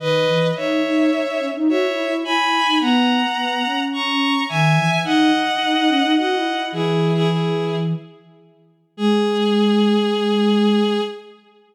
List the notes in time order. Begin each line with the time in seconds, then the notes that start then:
0.00 D#3 B4 D#5
0.28 E3
0.56 D#4 C#5 E5
0.84 D#4
1.11 D#4
1.27 D#4
1.41 C#4
1.55 D#4
1.68 F#4 C#5 E5
1.86 E4
2.06 E4
2.24 E4 G#5 B5
2.66 D#4
2.80 B3 F#5 A#5
3.37 B3
3.65 C#4
3.93 A#5 C#6
4.49 D#3 E5 G#5
4.76 E3
5.04 D#4 D#5 F#5
5.34 D#4
5.61 D#4
5.75 D#4
5.89 C#4
6.03 D#4
6.17 F#4 D#5 F#5
6.35 E4
6.54 E4
6.72 E3 E4 G#4
7.15 E4 G#4
7.29 E4 G#4
8.97 G#3 G#4